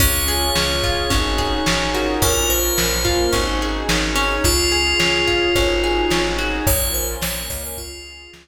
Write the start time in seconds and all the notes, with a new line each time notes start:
0.00 C#2 C#4 F4 G#4 C#5, kick, closed hi-hat
0.28 G#4, closed hi-hat
0.55 C#2 C#4 G#4 C#5, snare
0.83 F4, kick, closed hi-hat
1.10 G#1 C#4 D#4 F#4 G#4, kick, closed hi-hat
1.38 G#4, kick, closed hi-hat
1.66 G#1 C#4 D#4 G#4 C#5, snare
1.94 C#4 F4 F#4 A#4, closed hi-hat
2.22 A#1 C#4 F4 A#4, kick, closed hi-hat
2.50 A#4 C5, closed hi-hat
2.78 A#1 A#3 C#4 A#4, snare
3.05 F4, kick, closed hi-hat
3.33 G#1 C#4 D#4 F#4 G#4, kick, closed hi-hat
3.61 G#4, closed hi-hat
3.89 G#1 C#4 D#4 G#4 C#5, snare
4.16 C#4, open hi-hat
4.44 C#2 C#4 F4 G#4, kick, closed hi-hat
4.72 G#4, closed hi-hat
4.99 C#2 C#4 G#4 C#5, snare
5.27 F4, kick, closed hi-hat
5.56 G#1 C#4 D#4 F#4 G#4, kick, closed hi-hat
5.83 G#4, closed hi-hat
6.10 G#1 C#4 D#4 G#4 C#5, snare
6.39 F#4, closed hi-hat
6.67 A#1 C#4 F4 A#4 C#5, kick, closed hi-hat
6.94 C5, closed hi-hat
7.22 A#1 A#3 C#4 A#4 C#5, snare
7.50 C#2 C#5, kick, closed hi-hat
7.64 C#5
7.78 C#4 F4 G#4, kick, closed hi-hat
8.06 closed hi-hat
8.33 C#2 C#4 G#4 C#5, snare